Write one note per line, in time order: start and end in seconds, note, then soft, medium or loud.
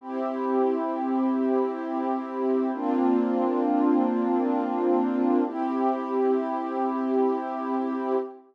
0.01 2.71 C4 medium
0.01 2.71 E4 medium
0.01 2.71 G4 medium
2.73 5.43 A#3 medium
2.73 5.43 C4 medium
2.73 5.43 D4 medium
2.73 5.43 F4 medium
5.46 8.16 C4 medium
5.46 8.16 E4 medium
5.46 8.16 G4 medium